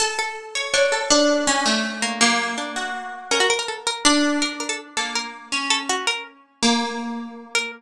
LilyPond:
<<
  \new Staff \with { instrumentName = "Orchestral Harp" } { \time 6/8 \tempo 4. = 109 a'4 r8 des''8 des''8 a'8 | d'4 des'8 a4 r8 | bes4 r8 ges'4. | bes'2 d'4 |
r4. bes4. | des'2~ des'8 r8 | bes2. | }
  \new Staff \with { instrumentName = "Harpsichord" } { \time 6/8 r8 a'4 r8 d'4 | r2 r8 bes8 | ges4 d'4 r4 | des'16 ges'16 bes'16 bes'16 a'16 r16 bes'8 r4 |
bes'8 bes'16 a'16 r8 a'8 bes'4 | r8 a'16 r16 ges'8 bes'8 r4 | r2 r8 bes'8 | }
>>